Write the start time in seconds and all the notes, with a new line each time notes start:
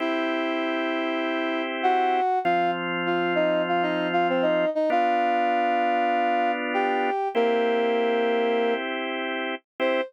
0.00 C4 E4 G4 E5
1.83 F#4 F#5
2.44 F3 C4 F4 F5
3.06 F4 F5
3.35 D#4 D#5
3.68 F4 F5
3.83 D#4 D#5
4.13 F4 F5
4.29 C4 C5
4.42 D#4 D#5
4.75 D#4 D#5
4.90 B3 D4 F4 F5
6.74 G4 G5
7.35 A#3 C4 E4 G4 A#4
9.80 C4 E4 G4 C5